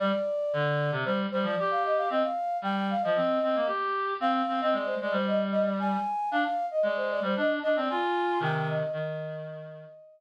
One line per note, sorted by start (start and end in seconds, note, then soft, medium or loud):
0.00 0.12 G3 loud
0.00 0.91 D5 loud
0.53 0.91 D3 medium
0.92 1.04 C3 loud
1.05 1.27 G3 medium
1.05 1.18 C5 loud
1.32 1.46 G3 medium
1.32 1.44 C5 loud
1.43 1.55 F3 medium
1.43 1.56 D5 loud
1.57 2.09 G4 medium
1.57 1.69 D5 medium
1.71 1.83 F5 medium
1.85 1.97 D#5 medium
1.97 2.09 F5 medium
2.10 2.23 C4 loud
2.10 2.23 D#5 loud
2.23 2.57 F5 medium
2.62 2.94 G3 medium
2.62 2.88 G5 medium
2.90 3.03 F5 medium
3.02 3.17 F3 medium
3.02 3.66 D#5 medium
3.16 3.39 C4 medium
3.43 3.56 C4 medium
3.55 3.68 A#3 medium
3.66 4.14 G4 medium
4.20 4.42 C4 loud
4.20 4.33 F5 medium
4.34 4.60 F5 medium
4.48 4.61 C4 medium
4.61 4.74 C4 loud
4.61 4.73 D#5 medium
4.72 4.95 G#3 medium
4.72 4.86 D5 medium
4.86 4.98 C5 medium
5.01 5.14 G#3 medium
5.01 5.13 D5 medium
5.11 5.97 G3 medium
5.11 5.26 C5 loud
5.26 5.39 D#5 medium
5.52 5.64 D#5 medium
5.65 5.78 D5 medium
5.79 6.29 G#5 medium
6.31 6.44 D4 loud
6.31 6.44 F5 loud
6.45 6.66 F5 loud
6.71 6.83 D#5 medium
6.83 7.20 G#3 medium
6.83 6.96 D5 loud
6.96 7.09 C5 medium
7.10 7.23 D5 medium
7.22 7.35 G3 medium
7.22 7.36 C5 medium
7.36 7.59 D4 medium
7.36 7.50 D#5 medium
7.63 7.76 D4 medium
7.63 7.76 D#5 loud
7.76 7.89 C4 loud
7.76 7.89 D5 medium
7.89 8.39 F4 loud
7.89 8.40 G#5 medium
8.40 8.83 C3 medium
8.40 8.83 D#3 medium
8.40 8.54 G5 loud
8.55 8.68 G5 loud
8.69 8.93 D#5 medium
8.93 9.85 D#3 loud
8.93 10.20 D#5 loud